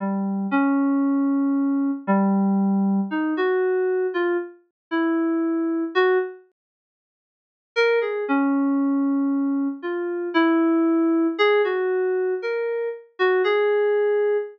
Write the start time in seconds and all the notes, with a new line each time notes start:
0.00 G3
0.51 C#4
2.07 G3
3.11 D#4
3.37 F#4
4.14 F4
4.91 E4
5.95 F#4
7.76 A#4
8.01 G#4
8.28 C#4
9.82 F4
10.34 E4
11.39 G#4
11.64 F#4
12.42 A#4
13.19 F#4
13.44 G#4